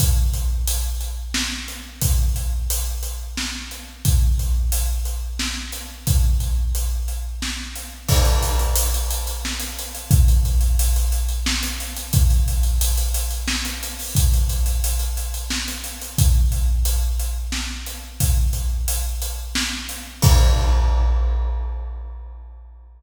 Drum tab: CC |------------|------------|------------|------------|
HH |x-x-x-x---x-|x-x-x-x---x-|x-x-x-x---x-|x-x-x-x---x-|
SD |--------o---|--------o---|--------o---|--------o---|
BD |o-----------|o-----------|o-----------|o-----------|

CC |x-----------|------------|------------|------------|
HH |-xxxxxxx-xxx|xxxxxxxx-xxx|xxxxxxxx-xxo|xxxxxxxx-xxx|
SD |--------o---|--------o---|--------o---|--------o---|
BD |o-----------|o-----------|o-----------|o-----------|

CC |------------|------------|x-----------|
HH |x-x-x-x---x-|x-x-x-x---x-|------------|
SD |--------o---|--------o---|------------|
BD |o-----------|o-----------|o-----------|